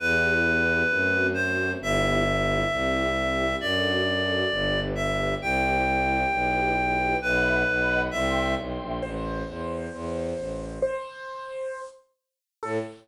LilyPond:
<<
  \new Staff \with { instrumentName = "Clarinet" } { \time 4/4 \key e \minor \tempo 4 = 133 b'2. c''4 | e''1 | d''2. e''4 | g''1 |
b'2 e''4 r4 | \key a \minor r1 | r1 | r1 | }
  \new Staff \with { instrumentName = "Acoustic Grand Piano" } { \time 4/4 \key e \minor r1 | r1 | r1 | r1 |
r1 | \key a \minor c''1 | c''2~ c''8 r4. | a'4 r2. | }
  \new Staff \with { instrumentName = "String Ensemble 1" } { \time 4/4 \key e \minor <b e' g'>4 <b e' g'>4 <a c' fis'>4 <a c' fis'>4 | <b e' g'>4 <b e' g'>4 <c' e' g'>4 <c' e' g'>4 | <d' fis' a'>4 <d' fis' a'>4 <d' g' b'>4 <d' g' b'>4 | <e' g' c''>4 <e' g' c''>4 <e' g' b'>4 <e' g' b'>4 |
<e'' fis'' b''>4 <dis'' fis'' b''>4 <e'' g'' c'''>4 <e'' g'' c'''>4 | \key a \minor r1 | r1 | r1 | }
  \new Staff \with { instrumentName = "Violin" } { \clef bass \time 4/4 \key e \minor e,2 fis,2 | g,,2 c,2 | fis,2 g,,2 | c,2 b,,2 |
b,,4 b,,4 c,4 b,,8 ais,,8 | \key a \minor a,,4 e,4 e,4 a,,4 | r1 | a,4 r2. | }
>>